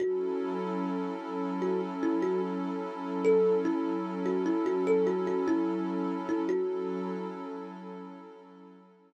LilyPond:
<<
  \new Staff \with { instrumentName = "Kalimba" } { \time 4/4 \key fis \minor \tempo 4 = 74 fis'4 r4 fis'16 r16 e'16 fis'16 r4 | a'8 e'8 r16 fis'16 e'16 fis'16 a'16 fis'16 fis'16 e'4 e'16 | fis'4. r2 r8 | }
  \new Staff \with { instrumentName = "Pad 2 (warm)" } { \time 4/4 \key fis \minor <fis cis' e' a'>1~ | <fis cis' e' a'>1 | <fis cis' e' a'>1 | }
>>